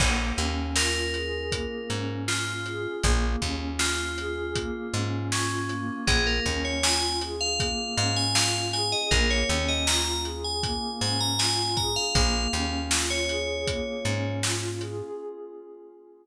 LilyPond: <<
  \new Staff \with { instrumentName = "Tubular Bells" } { \time 4/4 \key bes \dorian \tempo 4 = 79 r4 bes'2 f'4 | r4 f'2 des'4 | aes'16 bes'8 des''16 aes''8 r16 f''8. f''16 aes''16 f''8 aes''16 ees''16 | bes'16 des''8 ees''16 bes''8 r16 aes''8. aes''16 bes''16 aes''8 bes''16 f''16 |
f''4 r16 des''4.~ des''16 r4 | }
  \new Staff \with { instrumentName = "Pad 2 (warm)" } { \time 4/4 \key bes \dorian bes8 des'8 f'8 aes'8 bes8 des'8 f'8 aes'8 | bes8 des'8 f'8 aes'8 bes8 des'8 f'8 bes8~ | bes8 des'8 f'8 aes'8 bes8 des'8 f'8 aes'8 | bes8 des'8 f'8 aes'8 bes8 des'8 f'8 aes'8 |
bes8 des'8 f'8 aes'8 bes8 des'8 f'8 aes'8 | }
  \new Staff \with { instrumentName = "Electric Bass (finger)" } { \clef bass \time 4/4 \key bes \dorian bes,,8 ees,2 aes,4. | bes,,8 ees,2 aes,4. | bes,,8 ees,2 aes,4. | bes,,8 ees,2 aes,4. |
bes,,8 ees,2 aes,4. | }
  \new DrumStaff \with { instrumentName = "Drums" } \drummode { \time 4/4 <cymc bd>8 hh8 sn8 hh8 <hh bd>8 hh8 sn8 hh8 | <hh bd>8 <hh bd>8 sn8 hh8 <hh bd>8 hh8 sn8 hh8 | <hh bd>8 <hh bd>8 sn8 hh8 <hh bd>8 hh8 sn8 hh8 | <hh bd>8 hh8 sn8 hh8 <hh bd>8 hh8 sn8 <hh bd>8 |
<hh bd>8 hh8 sn8 hh8 <hh bd>8 hh8 sn8 hh8 | }
>>